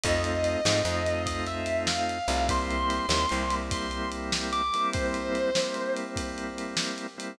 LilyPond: <<
  \new Staff \with { instrumentName = "Distortion Guitar" } { \time 12/8 \key c \major \tempo 4. = 98 ees''2. ees''8 e''4 f''4. | c'''2. c'''4 r4 d'''4 | c''2. r2. | }
  \new Staff \with { instrumentName = "Drawbar Organ" } { \time 12/8 \key c \major <a c' ees' f'>4. <a c' ees' f'>8 <a c' ees' f'>2.~ <a c' ees' f'>8 <a c' ees' f'>8 | <g bes c' e'>4. <g bes c' e'>8 <g bes c' e'>2.~ <g bes c' e'>8 <g bes c' e'>8 | <g bes c' e'>4. <g bes c' e'>8 <g bes c' e'>2.~ <g bes c' e'>8 <g bes c' e'>8 | }
  \new Staff \with { instrumentName = "Electric Bass (finger)" } { \clef bass \time 12/8 \key c \major f,4. gis,8 f,2.~ f,8 c,8~ | c,4. ees,8 c,1 | r1. | }
  \new DrumStaff \with { instrumentName = "Drums" } \drummode { \time 12/8 <bd cymr>8 cymr8 cymr8 sn8 cymr8 cymr8 <bd cymr>8 cymr8 cymr8 sn8 cymr8 cymr8 | <bd cymr>8 cymr8 cymr8 sn8 cymr8 cymr8 <bd cymr>8 cymr8 cymr8 sn8 cymr8 cymr8 | <bd cymr>8 cymr8 cymr8 sn8 cymr8 cymr8 <bd cymr>8 cymr8 cymr8 sn8 cymr8 cymr8 | }
>>